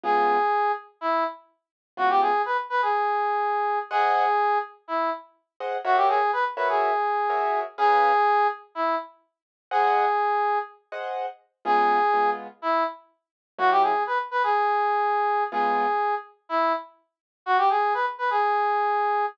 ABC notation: X:1
M:4/4
L:1/16
Q:1/4=124
K:Db
V:1 name="Brass Section"
A6 z2 =E2 z6 | G =G A2 _c z c A9 | A6 z2 =E2 z6 | G =G A2 =B z B A9 |
A6 z2 =E2 z6 | A8 z8 | A6 z2 =E2 z6 | G =G A2 =B z B A9 |
A6 z2 =E2 z6 | G =G A2 _c z c A9 |]
V:2 name="Acoustic Grand Piano"
[D,A,_CF]16 | [D,A,_CF]16 | [Aceg]14 [Aceg]2 | [GBd_f]6 [GBdf]6 [GBdf]4 |
[DA_cf]16 | [Aceg]10 [Aceg]6 | [D,A,_CF]4 [D,A,CF]12 | [G,B,D_F]16 |
[D,A,_CF]16 | z16 |]